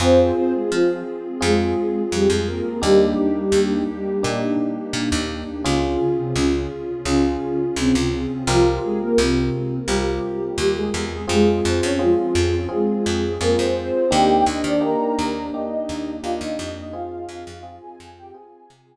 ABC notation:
X:1
M:4/4
L:1/16
Q:1/4=85
K:Fm
V:1 name="Ocarina"
[Cc]2 [Cc] [A,A] [F,F]2 z2 [A,A]4 [G,G] [A,A] [B,B]2 | [G,G]8 z8 | [D,D]2 [D,D] [C,C] [D,D]2 z2 [D,D]4 [C,C] [C,C] [C,C]2 | [F,F]2 [A,A] [B,B] [C,C]4 [G,G]4 [G,G] [A,A] [A,A]2 |
[A,A]2 [Cc] [Dd] [F,F]4 [A,A]4 [B,B] [Cc] [Cc]2 | [Gg]2 [Ee] [=D=d] [Bb]4 [Ee]4 [Ff] [Ee] [Ee]2 | [Ff]2 [Ff]3 [Aa]2 [Gg] [Aa]6 z2 |]
V:2 name="Electric Piano 1"
[CFA]8 [CFA]8 | [B,=DEG]8 [B,DEG]8 | [DFA]8 [DFA]8 | [CFGB]8 [CFGB]8 |
[CFA]4 [CFA]4 [CFA]4 [CFA]4 | [B,=DEG]4 [B,DEG]4 [B,DEG]4 [B,DEG]4 | [CFA]4 [CFA]4 [CFA]4 z4 |]
V:3 name="Electric Bass (finger)" clef=bass
F,,4 F,4 F,,4 F,, F,,3 | E,,4 E,,4 B,,4 B,, E,,3 | D,,4 D,,4 D,,4 D,, D,,3 | C,,4 C,,4 C,,4 E,,2 =E,,2 |
F,,2 F,, F,,3 F,,4 F,,2 F,, F,,3 | E,,2 E,, E,3 E,,4 E,,2 E,, E,, F,,2- | F,,2 F,, F,,3 F,,4 C,2 z4 |]
V:4 name="Pad 2 (warm)"
[CFA]16 | [B,=DEG]16 | [DFA]16 | z16 |
[CFA]16 | [B,=DEG]16 | [CFA]16 |]